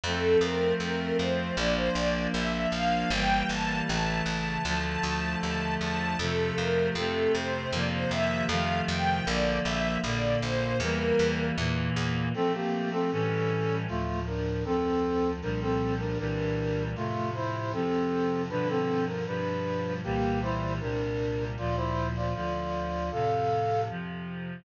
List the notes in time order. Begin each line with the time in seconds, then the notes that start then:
0.04 F2 F3 A3 C4 A4
0.41 F2 A#4
0.80 F2 A#4
1.19 F2 C5
1.57 A#1 F3 A#3 D4 D5
1.77 C5
1.95 A#1 D5
2.34 A#1 E5
2.72 A#1 F5
3.10 G1 E3 G3 A#3 G5
3.49 G1 A5
3.87 A1 C#3 E3 A3 A5
4.26 A1 A5
4.65 D2 D3 F3 A3 A5
4.84 A5
5.03 D2 A5
5.42 D#2 A5
5.80 E2 A5
6.19 F2 C3 F3 A3 A4
6.57 F2 A#4
6.95 F2 C3 A3 C4 A4
7.34 F2 C5
7.73 F2 C3 D#3 F3 A#3 D5
7.92 C5
8.11 F2 E5
8.49 F2 C3 D#3 F3 A3 F5
8.88 F2 G5
9.26 A#1 D3 F3 A#3 D5
9.65 A#1 E5
10.03 A#1 A#2 D3 A#3 D5
10.42 A#1 C5
10.80 E2 E3 G3 A#3 A#4
11.19 E2
11.56 E2 A#2 E3 A#3
11.96 E2
12.34 F3 A3 C4 A4
12.54 A#3 G4
12.92 C4 A4
13.11 A2 E3 G3 C#4 A4
13.87 D2 A2 F3 A3 F4
14.27 D4 A#4
14.65 D2 F2 F3 C4 A4
15.41 C2 A#2 F3 G3 D4 A#4
15.61 C4 A4
16.00 D4 A#4
16.18 C2 A#2 E3 G3 D4 A#4
16.96 F2 A2 C3 A3 F4
17.34 E4 C5
17.73 F2 C3 F3 C4 A4
18.50 G2 B2 D3 F3 D4 B4
18.69 C4 A4
19.07 A#4
19.26 G2 B2 F3 G3 D4 B4
20.04 C2 A#2 E3 G3 A#3 G4
20.42 E4 C5
20.80 C2 A#2 C3 G3 D4 A#4
21.57 D2 A#2 F3 F4 D5
21.77 E4 C5
22.15 F4 D5
22.34 D2 D3 F3 F4 D5
23.11 F2 A2 C3 A4 F5
23.89 F2 C3 F3